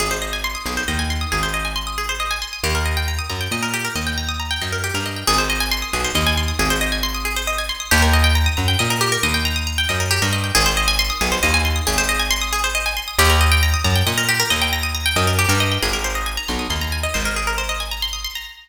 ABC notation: X:1
M:6/8
L:1/16
Q:3/8=91
K:Ablyd
V:1 name="Pizzicato Strings"
A c e a c' e' A c e a c' e' | A c e a c' e' A c e a c' e' | G B e g b e' b g e B G B | e g b e' b g e B G B e g |
A c e a c' e' A c e a c' e' | A c e a c' e' A c e a c' e' | G B e g b e' b g e B G B | e g b e' b g e B G B e g |
A c e a c' e' A c e a c' e' | A c e a c' e' A c e a c' e' | G B e g b e' b g e B G B | e g b e' b g e B G B e g |
A B c e a b c' e' c' b a e | c B A B c e a b c' e' c' b |]
V:2 name="Electric Bass (finger)" clef=bass
A,,,6 =B,,,2 E,,4 | A,,,12 | E,,6 _G,,2 B,,4 | E,,6 _G,,3 =G,,3 |
A,,,6 =B,,,2 E,,4 | A,,,12 | E,,6 _G,,2 B,,4 | E,,6 _G,,3 =G,,3 |
A,,,6 =B,,,2 E,,4 | A,,,12 | E,,6 _G,,2 B,,4 | E,,6 _G,,3 =G,,3 |
A,,,6 =B,,,2 E,,4 | A,,,12 |]